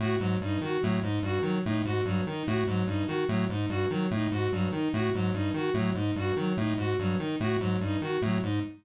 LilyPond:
<<
  \new Staff \with { instrumentName = "Lead 1 (square)" } { \clef bass \time 7/8 \tempo 4 = 146 a,8 aes,8 g,8 ees8 a,8 aes,8 g,8 | ees8 a,8 aes,8 g,8 ees8 a,8 aes,8 | g,8 ees8 a,8 aes,8 g,8 ees8 a,8 | aes,8 g,8 ees8 a,8 aes,8 g,8 ees8 |
a,8 aes,8 g,8 ees8 a,8 aes,8 g,8 | ees8 a,8 aes,8 g,8 ees8 a,8 aes,8 | }
  \new Staff \with { instrumentName = "Violin" } { \time 7/8 ges'8 ges8 ees'8 ges'8 ges8 ees'8 ges'8 | ges8 ees'8 ges'8 ges8 ees'8 ges'8 ges8 | ees'8 ges'8 ges8 ees'8 ges'8 ges8 ees'8 | ges'8 ges8 ees'8 ges'8 ges8 ees'8 ges'8 |
ges8 ees'8 ges'8 ges8 ees'8 ges'8 ges8 | ees'8 ges'8 ges8 ees'8 ges'8 ges8 ees'8 | }
>>